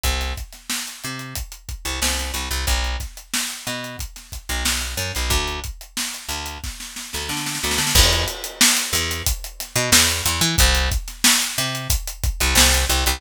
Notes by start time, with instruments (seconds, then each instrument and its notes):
0.04 electric bass (finger) C2, kick, closed hi-hat
0.21 snare, closed hi-hat
0.37 kick, closed hi-hat
0.53 snare, closed hi-hat
0.70 snare
0.88 closed hi-hat
1.04 electric bass (finger) C3, closed hi-hat
1.19 closed hi-hat
1.35 kick, closed hi-hat
1.52 closed hi-hat
1.69 kick, closed hi-hat
1.85 electric bass (finger) C2, closed hi-hat
2.02 electric bass (finger) C2, snare
2.19 snare, closed hi-hat
2.34 electric bass (finger) C2, closed hi-hat
2.51 electric bass (finger) C2, closed hi-hat
2.67 electric bass (finger) B1, kick, closed hi-hat
2.84 closed hi-hat
3.00 kick, snare, closed hi-hat
3.17 closed hi-hat
3.34 snare
3.50 closed hi-hat
3.67 electric bass (finger) B2, closed hi-hat
3.84 closed hi-hat
3.99 kick, closed hi-hat
4.16 snare, closed hi-hat
4.32 kick, closed hi-hat
4.49 electric bass (finger) B1, closed hi-hat
4.65 electric bass (finger) B1, snare
4.81 closed hi-hat
4.97 electric bass (finger) F#2, closed hi-hat
5.15 electric bass (finger) B1, closed hi-hat
5.30 electric bass (finger) D2, kick, closed hi-hat
5.48 closed hi-hat
5.64 kick, closed hi-hat
5.81 closed hi-hat
5.97 snare
6.14 closed hi-hat
6.29 electric bass (finger) D2, closed hi-hat
6.46 closed hi-hat
6.64 kick, snare
6.80 snare
6.96 snare
7.13 electric bass (finger) D2, snare
7.29 electric bass (finger) D3, snare
7.37 snare
7.46 snare
7.55 snare
7.63 electric bass (finger) D2, snare
7.71 snare
7.78 electric bass (finger) D3, snare
7.87 snare
7.95 electric bass (finger) E2, kick, crash
8.11 snare, closed hi-hat
8.28 closed hi-hat
8.44 closed hi-hat
8.61 snare
8.77 snare, closed hi-hat
8.93 electric bass (finger) E2, closed hi-hat
9.11 snare, closed hi-hat
9.27 kick, closed hi-hat
9.44 closed hi-hat
9.60 snare, closed hi-hat
9.76 electric bass (finger) B2, closed hi-hat
9.92 electric bass (finger) E2, snare
10.11 closed hi-hat
10.26 electric bass (finger) E2, closed hi-hat
10.41 electric bass (finger) E3, closed hi-hat
10.58 electric bass (finger) C2, kick, closed hi-hat
10.75 snare, closed hi-hat
10.91 kick, closed hi-hat
11.08 snare, closed hi-hat
11.24 snare
11.42 closed hi-hat
11.58 electric bass (finger) C3, closed hi-hat
11.75 closed hi-hat
11.90 kick, closed hi-hat
12.07 closed hi-hat
12.23 kick, closed hi-hat
12.40 electric bass (finger) C2, closed hi-hat
12.55 electric bass (finger) C2, snare
12.73 snare, closed hi-hat
12.89 electric bass (finger) C2, closed hi-hat
13.06 electric bass (finger) C2, closed hi-hat